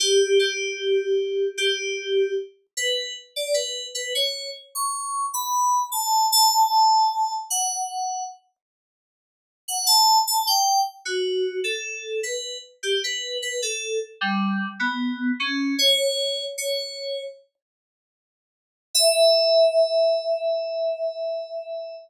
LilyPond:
\new Staff { \time 4/4 \key e \dorian \tempo 4 = 76 g'8 g'4. g'4 r8 b'8 | r16 d''16 b'8 b'16 cis''8 r16 cis'''8. b''8. a''8 | a''4. fis''4 r4. | r16 fis''16 a''8 a''16 g''8 r16 fis'8. a'8. b'8 |
r16 g'16 b'8 b'16 a'8 r16 g8. b8. cis'8 | cis''4 cis''4 r2 | e''1 | }